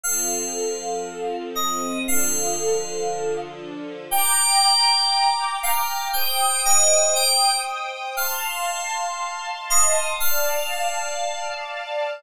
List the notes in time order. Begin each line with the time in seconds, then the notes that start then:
0.03 F3 C4 A4 F5
1.55 D#5
2.06 D3 F3 A4 F5
4.10 G5 A#5 D6
5.63 F5
6.13 C5 G5 D#6
6.65 D#5
7.15 G5
8.17 F5 A5 C6
9.70 D#5
10.20 D5 F5 A5